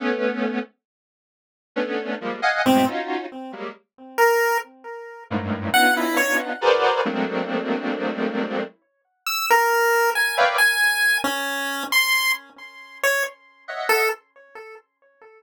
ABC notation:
X:1
M:2/4
L:1/16
Q:1/4=68
K:none
V:1 name="Lead 1 (square)"
[A,B,_D]3 z5 | [A,B,_D=D]2 [F,G,_A,_B,] [_ef_g_a] [_A,,=A,,=B,,] [_D_EF_G]2 z | [_G,=G,_A,_B,] z7 | [_G,,=G,,_A,,=A,,]2 [B,_D=D_EF]4 [_G_A_B=Bcd]2 |
[_G,_A,=A,_B,CD]8 | z7 [B_d=defg] | z8 | z6 [_e=e_g]2 |]
V:2 name="Lead 1 (square)"
z8 | z4 C z3 | z3 _B2 z3 | z2 _g E _d z3 |
z8 | z2 e' _B3 _a z | _a3 _D3 c'2 | z3 _d z3 A |]